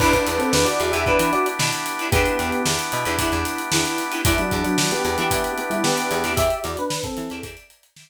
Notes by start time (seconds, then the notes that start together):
0.00 E2 B3 D4 E4 G4 B4, kick, crash
0.13 D4 B4, kick, closed hi-hat
0.27 E2, closed hi-hat
0.38 C4 A4, closed hi-hat
0.52 E2 D4 B4, snare
0.65 F#4 D5, closed hi-hat
0.80 E2, closed hi-hat
0.92 E2 E4 G4 B4 E5, closed hi-hat
0.96 D4
1.06 E2 D4 E4 G4 B4, kick
1.19 E3, closed hi-hat
1.33 F#4 D5, closed hi-hat
1.46 closed hi-hat
1.59 B2 D4 E4 G4 B4, snare
1.72 snare, closed hi-hat
1.86 closed hi-hat
1.99 D4 E4 G4 B4, closed hi-hat
2.12 E2 B3 D4 E4 G4 B4, kick, closed hi-hat
2.16 D4
2.26 closed hi-hat
2.39 E2, snare, closed hi-hat
2.52 closed hi-hat
2.66 E2, snare
2.79 closed hi-hat
2.92 B2, closed hi-hat
3.05 E2 D4 E4 G4 B4, closed hi-hat
3.18 E2 D4 E4 G4 B4, kick, closed hi-hat
3.32 E2, closed hi-hat
3.45 snare, closed hi-hat
3.58 closed hi-hat
3.71 E2 D4 E4 G4 B4, snare
3.85 closed hi-hat
3.98 snare, closed hi-hat
4.11 D4 E4 G4 B4, closed hi-hat
4.24 E2 G3 B3 D4 E4 G4 D5 E5 G5 B5, kick, closed hi-hat
4.38 F#3 D4, closed hi-hat
4.51 E2, kick, closed hi-hat
4.64 F#3 D4, closed hi-hat
4.78 F#3 D4, snare
4.91 B3 G4, closed hi-hat
5.04 E2 B3 G4, closed hi-hat
5.18 E3 B3 G4 D5 E5 G5 B5, closed hi-hat
5.31 E3 D5 E5 G5 B5, kick, closed hi-hat
5.44 closed hi-hat
5.58 B3 G4, closed hi-hat
5.70 G3 E4, closed hi-hat
5.84 B3 G4 D5 E5 G5 B5, snare
5.97 closed hi-hat
6.11 E2, closed hi-hat
6.24 E2 D5 E5 G5 B5, snare, closed hi-hat
6.37 E2 G4 D5 E5 G5 B5, kick, closed hi-hat
6.50 closed hi-hat
6.64 E2 F#4 D5, snare, closed hi-hat
6.77 D4 B4, closed hi-hat
6.90 snare
7.04 C4 A4, kick, closed hi-hat
7.17 E3, closed hi-hat
7.30 E2 D5 E5 G5 B5, closed hi-hat
7.43 E2 D5 E5 G5 B5, kick, closed hi-hat
7.57 closed hi-hat
7.70 closed hi-hat
7.83 closed hi-hat
7.96 D5 E5 G5 B5, snare